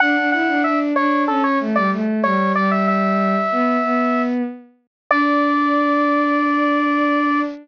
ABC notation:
X:1
M:4/4
L:1/16
Q:1/4=94
K:D
V:1 name="Lead 1 (square)"
f2 f2 e z c2 A c z d z2 c2 | d e e10 z4 | d16 |]
V:2 name="Violin"
D D E D D2 D2 C2 A, G, A,2 G,2 | G,6 B,2 B,4 z4 | D16 |]